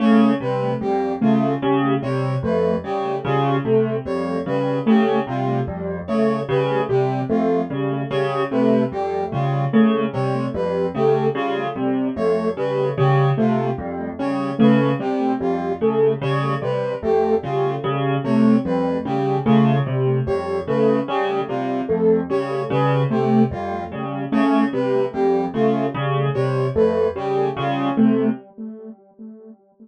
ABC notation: X:1
M:5/8
L:1/8
Q:1/4=74
K:none
V:1 name="Acoustic Grand Piano" clef=bass
_D, C, F,, D, D, | C, F,, _D, D, C, | F,, _D, D, C, F,, | _D, D, C, F,, D, |
_D, C, F,, D, D, | C, F,, _D, D, C, | F,, _D, D, C, F,, | _D, D, C, F,, D, |
_D, C, F,, D, D, | C, F,, _D, D, C, | F,, _D, D, C, F,, | _D, D, C, F,, D, |
_D, C, F,, D, D, | C, F,, _D, D, C, |]
V:2 name="Lead 2 (sawtooth)"
A, G, G, A, G, | G, A, G, G, A, | G, G, A, G, G, | A, G, G, A, G, |
G, A, G, G, A, | G, G, A, G, G, | A, G, G, A, G, | G, A, G, G, A, |
G, G, A, G, G, | A, G, G, A, G, | G, A, G, G, A, | G, G, A, G, G, |
A, G, G, A, G, | G, A, G, G, A, |]
V:3 name="Brass Section"
_d B G F z | _d B G F z | _d B G F z | _d B G F z |
_d B G F z | _d B G F z | _d B G F z | _d B G F z |
_d B G F z | _d B G F z | _d B G F z | _d B G F z |
_d B G F z | _d B G F z |]